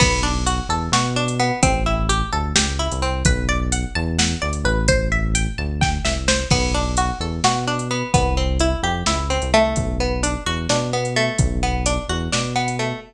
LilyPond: <<
  \new Staff \with { instrumentName = "Pizzicato Strings" } { \time 7/8 \key b \phrygian \tempo 4 = 129 b8 d'8 fis'8 a'8 fis'8 d'8 b8 | c'8 e'8 g'8 a'8 g'8 e'8 c'8 | b'8 d''8 fis''8 a''8 fis''8 d''8 b'8 | c''8 e''8 g''8 a''8 g''8 e''8 c''8 |
b8 d'8 fis'8 a'8 fis'8 d'8 b8 | b8 c'8 e'8 g'8 e'8 c'8 a8~ | a8 b8 d'8 fis'8 d'8 b8 a8~ | a8 b8 d'8 fis'8 d'8 b8 a8 | }
  \new Staff \with { instrumentName = "Synth Bass 1" } { \clef bass \time 7/8 \key b \phrygian b,,4. e,8 b,4. | a,,4. d,8 cis,8. c,8. | b,,4. e,4 d,8 a,,8~ | a,,4. d,4 c,4 |
b,,4. e,8 b,4. | c,4. f,8 cis,8. c,8. | b,,4. e,8 b,4. | b,,4. e,8 b,4. | }
  \new DrumStaff \with { instrumentName = "Drums" } \drummode { \time 7/8 <cymc bd>4 hh4 sn8. hh8. | <hh bd>4 hh4 sn8. hh8. | <hh bd>4 hh4 sn8. hh8. | <hh bd>4 hh4 <bd sn>8 sn8 sn8 |
<cymc bd>4 hh4 sn8. hh8. | <hh bd>4 hh4 sn8. hh8. | <hh bd>4 hh4 sn8. hh8. | <hh bd>4 hh4 sn8. hh8. | }
>>